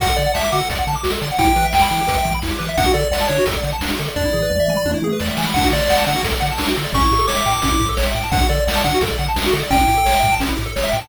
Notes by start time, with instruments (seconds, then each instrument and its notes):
0.00 synth bass 1 D2, lead 1 (square) F#4 F#5, kick, closed hi-hat
0.09 lead 1 (square) A4
0.16 synth bass 1 D3, lead 1 (square) D5, closed hi-hat
0.26 lead 1 (square) F#5
0.34 synth bass 1 D2, lead 1 (square) E5 A5, snare
0.44 lead 1 (square) D6
0.52 synth bass 1 D3, lead 1 (square) F#4 F#5, closed hi-hat
0.60 lead 1 (square) A4
0.70 synth bass 1 D2, lead 1 (square) D5, kick, closed hi-hat
0.78 lead 1 (square) F#5
0.87 synth bass 1 D3, lead 1 (square) A5, closed hi-hat
0.95 lead 1 (square) D6
1.03 synth bass 1 D2, lead 1 (square) F#4, snare
1.11 lead 1 (square) A4
1.21 synth bass 1 D3, lead 1 (square) D5, closed hi-hat
1.32 lead 1 (square) F#5
1.38 synth bass 1 E2, lead 1 (square) E4 G5, kick, closed hi-hat
1.47 lead 1 (square) G4
1.56 synth bass 1 E3, lead 1 (square) B4, closed hi-hat
1.64 lead 1 (square) E5
1.73 synth bass 1 E2, lead 1 (square) G5, snare
1.82 lead 1 (square) B5
1.91 synth bass 1 E3, lead 1 (square) E4, closed hi-hat
2.01 lead 1 (square) G4
2.07 synth bass 1 E2, lead 1 (square) B4, kick, closed hi-hat
2.17 lead 1 (square) E5
2.24 synth bass 1 E3, lead 1 (square) G5, kick, closed hi-hat
2.34 lead 1 (square) B5
2.42 synth bass 1 E2, lead 1 (square) E4, snare
2.51 lead 1 (square) G4
2.59 synth bass 1 E3, lead 1 (square) B4, closed hi-hat
2.68 lead 1 (square) E5
2.77 synth bass 1 D2, lead 1 (square) D4 F#5, kick, closed hi-hat
2.86 lead 1 (square) F#4
2.94 synth bass 1 D3, lead 1 (square) A4 D5, closed hi-hat
3.03 lead 1 (square) D5
3.11 synth bass 1 D2, lead 1 (square) D5 F#5, snare
3.21 lead 1 (square) A5
3.28 synth bass 1 D3, lead 1 (square) D4 C#5, closed hi-hat
3.38 lead 1 (square) F#4
3.46 synth bass 1 D2, lead 1 (square) A4, kick, closed hi-hat
3.57 lead 1 (square) D5
3.63 synth bass 1 D3, lead 1 (square) F#5, closed hi-hat
3.73 lead 1 (square) A5
3.81 synth bass 1 D2, lead 1 (square) D4, snare
3.91 lead 1 (square) F#4
3.99 synth bass 1 D3, lead 1 (square) A4, closed hi-hat
4.08 lead 1 (square) D5
4.16 synth bass 1 E2, lead 1 (square) D4 D5, kick, floor tom
4.25 lead 1 (square) E4
4.33 synth bass 1 E3, lead 1 (square) G#4, floor tom
4.42 lead 1 (square) B4
4.50 synth bass 1 E2, lead 1 (square) D5, mid tom
4.60 lead 1 (square) E5
4.68 synth bass 1 E3, lead 1 (square) G#5, mid tom
4.77 lead 1 (square) B5
4.85 synth bass 1 E2, lead 1 (square) D4, high tom
4.94 lead 1 (square) E4
5.02 synth bass 1 E3, lead 1 (square) G#4, high tom
5.12 lead 1 (square) B4
5.20 synth bass 1 E2, lead 1 (square) D5, snare
5.28 lead 1 (square) E5
5.37 synth bass 1 E3, lead 1 (square) G#5, snare
5.47 lead 1 (square) B5
5.54 synth bass 1 D2, lead 1 (square) D4 F#5, kick, crash
5.64 lead 1 (square) F#4
5.72 synth bass 1 D3, lead 1 (square) A4 D5, closed hi-hat
5.81 lead 1 (square) D5
5.89 synth bass 1 D2, lead 1 (square) D5 F#5, snare
5.97 lead 1 (square) A5
6.06 synth bass 1 D3, lead 1 (square) D4 F#5, closed hi-hat
6.16 lead 1 (square) F#4
6.23 synth bass 1 D2, lead 1 (square) A4, kick, closed hi-hat
6.34 lead 1 (square) D5
6.40 synth bass 1 D3, lead 1 (square) F#5, closed hi-hat
6.51 lead 1 (square) A5
6.58 synth bass 1 D2, lead 1 (square) D4, snare
6.68 lead 1 (square) F#4
6.76 synth bass 1 D3, lead 1 (square) A4, closed hi-hat
6.84 lead 1 (square) D5
6.93 synth bass 1 A1, lead 1 (square) C#4 C#6, kick, closed hi-hat
7.02 lead 1 (square) E4
7.11 synth bass 1 A2, lead 1 (square) G4, closed hi-hat
7.18 lead 1 (square) A4
7.27 synth bass 1 A1, lead 1 (square) C#5 D6, snare
7.36 lead 1 (square) E5
7.46 synth bass 1 A2, lead 1 (square) G5, closed hi-hat
7.53 lead 1 (square) A5
7.62 synth bass 1 A1, lead 1 (square) C#4, kick, closed hi-hat
7.72 lead 1 (square) E4
7.80 synth bass 1 A2, lead 1 (square) G4, kick, closed hi-hat
7.89 lead 1 (square) A4
7.97 synth bass 1 A1, lead 1 (square) C#5, snare
8.06 lead 1 (square) E5
8.15 synth bass 1 A2, lead 1 (square) G5, closed hi-hat
8.24 lead 1 (square) A5
8.32 synth bass 1 D2, lead 1 (square) D4 F#5, kick, closed hi-hat
8.41 lead 1 (square) F#4
8.49 synth bass 1 D3, lead 1 (square) A4 D5, closed hi-hat
8.60 lead 1 (square) D5
8.67 synth bass 1 D2, lead 1 (square) D5 F#5, snare
8.75 lead 1 (square) A5
8.84 synth bass 1 D3, lead 1 (square) D4 F#5, kick, closed hi-hat
8.94 lead 1 (square) F#4
9.01 synth bass 1 D2, lead 1 (square) A4, kick, closed hi-hat
9.10 lead 1 (square) D5
9.18 synth bass 1 D3, lead 1 (square) F#5, closed hi-hat
9.28 lead 1 (square) A5
9.36 synth bass 1 D2, lead 1 (square) D4, snare
9.46 lead 1 (square) F#4
9.52 synth bass 1 D3, lead 1 (square) A4, closed hi-hat
9.63 lead 1 (square) D5
9.70 synth bass 1 A1, lead 1 (square) C#4 G5, kick, closed hi-hat
9.81 lead 1 (square) E4
9.88 synth bass 1 A2, lead 1 (square) G4, closed hi-hat
9.97 lead 1 (square) A4
10.05 synth bass 1 A1, lead 1 (square) C#5, snare
10.14 lead 1 (square) E5
10.23 synth bass 1 A2, lead 1 (square) G5, kick, closed hi-hat
10.32 lead 1 (square) A5
10.39 synth bass 1 A1, lead 1 (square) C#4, kick, closed hi-hat
10.49 lead 1 (square) E4
10.57 synth bass 1 A2, lead 1 (square) G4, closed hi-hat
10.66 lead 1 (square) A4
10.76 synth bass 1 A1, lead 1 (square) C#5, snare
10.83 lead 1 (square) E5
10.91 synth bass 1 A2, lead 1 (square) G5, closed hi-hat
11.01 lead 1 (square) A5